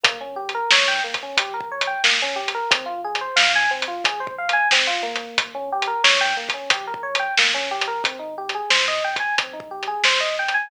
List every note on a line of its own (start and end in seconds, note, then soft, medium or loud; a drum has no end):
0.03 0.61 G1 medium
0.03 0.18 A#3 medium
0.03 kick loud
0.03 closed hi-hat loud
0.21 0.36 C#4 medium
0.36 0.51 G4 medium
0.49 closed hi-hat medium
0.55 0.70 A#4 medium
0.71 1.00 G2 medium
0.71 0.87 C#5 medium
0.71 snare loud
0.88 1.03 G5 medium
1.04 1.33 G1 medium
1.04 1.19 A#3 medium
1.14 kick medium
1.14 closed hi-hat medium
1.23 1.38 C#4 medium
1.37 1.94 A#1 medium
1.37 1.53 G4 medium
1.37 kick medium
1.37 closed hi-hat loud
1.54 1.69 A#4 medium
1.60 kick medium
1.71 1.86 C#5 medium
1.81 closed hi-hat medium
1.87 2.02 G5 medium
2.04 2.61 G1 medium
2.04 2.19 A#3 medium
2.04 snare loud
2.22 2.37 C#4 medium
2.36 2.51 G4 medium
2.48 closed hi-hat medium
2.54 2.69 A#4 medium
2.71 3.28 G#1 medium
2.71 2.86 C4 medium
2.71 kick loud
2.71 closed hi-hat loud
2.86 3.01 F4 medium
3.04 3.19 G#4 medium
3.15 closed hi-hat medium
3.21 3.36 C5 medium
3.36 3.66 G#2 medium
3.36 3.51 F5 medium
3.36 snare loud
3.55 3.70 G#5 medium
3.71 3.99 G#1 medium
3.71 3.86 C4 medium
3.82 closed hi-hat medium
3.88 4.03 F4 medium
4.04 4.61 B1 medium
4.04 4.20 G#4 medium
4.04 kick medium
4.04 closed hi-hat loud
4.20 4.35 C5 medium
4.27 kick loud
4.38 4.53 F5 medium
4.49 closed hi-hat medium
4.53 4.68 G#5 medium
4.70 5.27 G#1 medium
4.70 4.87 C4 medium
4.70 snare loud
4.87 5.02 F4 medium
5.03 5.51 A#3 medium
5.15 closed hi-hat medium
5.38 5.94 G1 medium
5.38 kick loud
5.38 closed hi-hat loud
5.54 5.69 C#4 medium
5.72 5.87 G4 medium
5.82 closed hi-hat medium
5.87 6.02 A#4 medium
6.04 6.33 G2 medium
6.04 6.19 C#5 medium
6.04 snare loud
6.21 6.36 G5 medium
6.37 6.65 G1 medium
6.37 6.52 A#3 medium
6.49 kick medium
6.49 closed hi-hat medium
6.54 6.69 C#4 medium
6.70 7.27 A#1 medium
6.70 6.86 G4 medium
6.70 kick medium
6.70 closed hi-hat loud
6.87 7.02 A#4 medium
6.94 kick medium
7.03 7.18 C#5 medium
7.15 closed hi-hat medium
7.19 7.34 G5 medium
7.37 7.68 A#1 medium
7.37 7.53 A#3 medium
7.37 snare loud
7.54 7.69 C#4 medium
7.70 8.00 A1 medium
7.70 7.86 G4 medium
7.81 closed hi-hat medium
7.88 8.03 A#4 medium
8.04 8.60 G#1 medium
8.04 8.19 C4 medium
8.04 kick loud
8.04 closed hi-hat medium
8.19 8.34 D#4 medium
8.38 8.53 G4 medium
8.49 closed hi-hat medium
8.54 8.69 G#4 medium
8.70 8.99 G#2 medium
8.70 8.85 C5 medium
8.70 snare loud
8.88 9.03 D#5 medium
9.04 9.32 G#1 medium
9.04 9.19 G5 medium
9.16 9.35 G#5 medium
9.16 kick medium
9.16 closed hi-hat medium
9.38 9.95 B1 medium
9.38 9.54 C4 medium
9.38 kick medium
9.38 closed hi-hat loud
9.53 9.68 D#4 medium
9.60 kick medium
9.71 9.86 G4 medium
9.83 closed hi-hat medium
9.87 10.02 G#4 medium
10.03 10.61 G#1 medium
10.03 10.20 C5 medium
10.03 snare loud
10.20 10.35 D#5 medium
10.39 10.54 G5 medium
10.48 closed hi-hat medium
10.54 10.69 G#5 medium